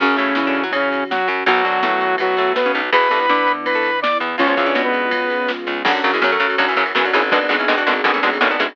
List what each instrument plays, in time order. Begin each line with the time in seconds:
0.00 electric bass (finger) F#2, overdriven guitar C#3 F#3, lead 2 (sawtooth) C#3 C#4, string ensemble 1 C#4 F#4, kick, crash
0.16 electric bass (finger) A2, overdriven guitar A3, ride
0.35 electric bass (finger) E3, overdriven guitar E4, snare
0.47 pizzicato strings D3 D4
0.55 ride
0.63 pizzicato strings F#3 F#4
0.72 pizzicato strings C#3 C#4, lead 2 (sawtooth) C#3 C#4, kick, ride
0.92 snare, ride
1.11 lead 2 (sawtooth) F#3 F#4, snare
1.28 electric bass (finger) F#2, overdriven guitar F#3, ride
1.46 electric bass (finger) B1, pizzicato strings F#2 F#3, overdriven guitar B2 F#3, lead 2 (sawtooth) F#3 F#4, string ensemble 1 B3 F#4, kick, ride
1.63 electric bass (finger) D2, overdriven guitar D3, kick, ride
1.83 electric bass (finger) A2, overdriven guitar A3, snare
2.01 ride
2.18 pizzicato strings B2 B3, lead 2 (sawtooth) F#3 F#4, kick, ride
2.37 pizzicato strings A2 A3, snare, ride
2.56 lead 2 (sawtooth) B3 B4, snare
2.66 pizzicato strings C#3 C#4
2.74 electric bass (finger) B1, overdriven guitar B2, ride
2.92 electric bass (finger) E2, overdriven guitar B2 E3, pizzicato strings B3 B4, string ensemble 1 B3 E4, lead 2 (sawtooth) B4 B5, kick, ride
3.11 electric bass (finger) G2, overdriven guitar G3, pizzicato strings A3 A4, ride
3.20 pizzicato strings B3 B4
3.29 electric bass (finger) D3, overdriven guitar D4, snare
3.47 pizzicato strings B3 B4, ride
3.66 lead 2 (sawtooth) B4 B5, kick, ride
3.75 pizzicato strings A3 A4
3.83 snare, ride
4.02 lead 2 (sawtooth) D5 D6, snare
4.20 electric bass (finger) E2, overdriven guitar E3, ride
4.38 electric bass (finger) C#2, pizzicato strings F3 F4, string ensemble 1 G#3 B3 C#4 F4, lead 2 (sawtooth) C#4 C#5, kick, ride
4.47 pizzicato strings F3 F4, lead 2 (sawtooth) C#4 C#5
4.57 electric bass (finger) E2, overdriven guitar E3, pizzicato strings F3 F4, kick, ride
4.66 pizzicato strings D3 D4
4.74 electric bass (finger) B2, overdriven guitar B3, snare
4.84 lead 2 (sawtooth) B3 B4
4.93 ride
5.11 kick, ride
5.30 snare, ride
5.48 snare
5.67 electric bass (finger) C#2, overdriven guitar C#3, ride
5.85 electric bass (finger) F#2, overdriven guitar C#3 F#3, pizzicato strings D3 F#3, string ensemble 1 C#4 F#4, kick, crash
5.94 ride
6.04 electric bass (finger) F#2, overdriven guitar C#3 F#3, ride
6.12 pizzicato strings E3 G#3, ride
6.22 electric bass (finger) F#2, overdriven guitar C#3 F#3, snare
6.31 pizzicato strings F#3 A3, ride
6.40 electric bass (finger) F#2, overdriven guitar C#3 F#3, ride
6.50 ride
6.58 electric bass (finger) F#2, overdriven guitar C#3 F#3, pizzicato strings D3 F#3, kick, ride
6.68 pizzicato strings C#3 E3, ride
6.76 electric bass (finger) F#2, overdriven guitar C#3 F#3, kick, ride
6.86 ride
6.95 electric bass (finger) F#2, overdriven guitar C#3 F#3, pizzicato strings C#3 E3, snare
7.04 pizzicato strings D3 F#3, ride
7.13 electric bass (finger) G#1, overdriven guitar C#3 F#3, pizzicato strings E3 G#3, ride
7.22 ride
7.31 overdriven guitar B2 D3 G#3, string ensemble 1 B3 D4 G#4, pizzicato strings B3 D4, kick, ride
7.41 ride
7.49 electric bass (finger) G#1, overdriven guitar B2 D3 G#3, ride
7.59 pizzicato strings C#4 E4, ride
7.68 electric bass (finger) G#1, overdriven guitar B2 D3 G#3, snare
7.77 pizzicato strings D4 F#4, ride
7.87 electric bass (finger) G#1, overdriven guitar B2 D3 G#3, ride
7.96 ride
8.04 electric bass (finger) G#1, overdriven guitar B2 D3 G#3, pizzicato strings B3 D4, kick, ride
8.14 pizzicato strings A3 C#4, ride
8.23 electric bass (finger) G#1, overdriven guitar B2 D3 G#3, ride
8.33 ride
8.41 electric bass (finger) G#1, overdriven guitar B2 D3 G#3, pizzicato strings A3 C#4, snare
8.51 pizzicato strings B3 D4, ride
8.59 electric bass (finger) G#1, overdriven guitar B2 D3 G#3, pizzicato strings C#4 E4, kick, ride
8.69 ride